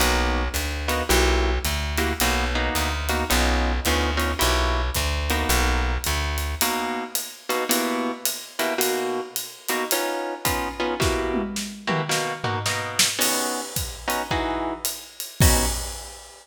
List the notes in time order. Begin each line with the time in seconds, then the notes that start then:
0.00 B1 A#3 B3 D#4 F#4, ride
0.54 D2, hi-hat pedal, ride
0.88 A#3 B3 D#4 F#4, ride
1.09 B1 A#3 E4 F#4 G4, ride
1.65 D2, hi-hat pedal, ride
1.98 A#3 E4 F#4 G4, ride
2.20 B1 A#3 B3 D#4 F#4, ride
2.55 A#3 B3 D#4 F#4
2.75 D2, hi-hat pedal, ride
3.09 A#3 B3 D#4 F#4, ride
3.30 B1 B3 C#4 D#4 F4, ride
3.85 D2 B3 C#4 D#4 F4, hi-hat pedal, ride
4.17 B3 C#4 D#4 F4, ride
4.39 B1 A#3 E4 F#4 G4, ride
4.94 D2, kick, hi-hat pedal, ride
5.30 A#3 B3 D#4 F#4, ride
5.49 B1, ride
6.04 D2, hi-hat pedal, ride
6.38 ride
6.61 B2 A#3 D#4 F#4, ride
7.15 hi-hat pedal, ride
7.49 B2 A#3 D#4 F#4, ride
7.69 B2 A#3 E4 F#4 G4, ride
8.25 hi-hat pedal, ride
8.59 B2 A#3 E4 F#4 G4, ride
8.78 B2 A#3 D#4 F#4, ride
9.36 ride
9.68 B2 A#3 D#4 F#4, hi-hat pedal, ride
9.91 B3 C#4 D#4 F4, ride
10.45 B3 C#4 D#4 F4, kick, hi-hat pedal, ride
10.80 B3 C#4 D#4 F4
11.00 B2 A#3 E4 F#4 G4, kick, snare
11.34 high tom
11.56 snare
11.87 B2 A#3 E4 F#4 G4, mid tom
12.09 B2 A#3 D#4 F#4, snare
12.44 B2 A#3 D#4 F#4, floor tom
12.66 B2 A#3 D#4 F#4, snare
12.99 snare
13.19 B3 C#4 D#4 F#4, crash, ride
13.76 kick, hi-hat pedal, ride
14.08 B3 C#4 D#4 F#4, ride
14.31 E3 D#4 F#4 G#4, kick
14.85 hi-hat pedal, ride
15.20 ride
15.40 B3 C#4 D#4 F#4, kick, crash